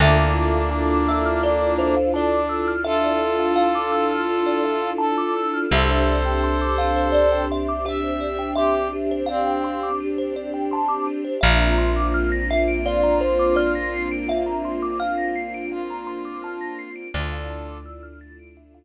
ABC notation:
X:1
M:4/4
L:1/16
Q:1/4=84
K:Dm
V:1 name="Kalimba"
e6 e2 d2 c2 d2 z2 | e4 f4 z4 a2 z2 | e6 f2 d2 e2 e2 z2 | e4 f4 z4 a2 z2 |
e6 e2 d2 c2 d2 z2 | e4 f4 z4 a2 z2 | d6 z10 |]
V:2 name="Brass Section"
[B,D]12 D4 | [FA]12 A4 | [Ac]12 e4 | G2 z2 C4 z8 |
z8 F8 | z8 F8 | [FA]4 z12 |]
V:3 name="Kalimba"
A d e f a d' e' f' A d e f a d' e' f' | A d e f a d' e' f' A d e f a d' e' f' | G c d g c' d' G c d g c' d' G c d g | c' d' G c d g c' d' G c d g c' d' G c |
f b c' d' f' b' c'' d'' f b c' d' f' b' c'' d'' | f b c' d' f' b' c'' d'' f b c' d' f' b' c'' d'' | e f a d' e' f' a' d'' e f z6 |]
V:4 name="Electric Bass (finger)" clef=bass
D,,16- | D,,16 | C,,16- | C,,16 |
B,,,16- | B,,,16 | D,,16 |]
V:5 name="String Ensemble 1"
[DEFA]16- | [DEFA]16 | [CDG]16- | [CDG]16 |
[B,CDF]16- | [B,CDF]16 | [A,DEF]16 |]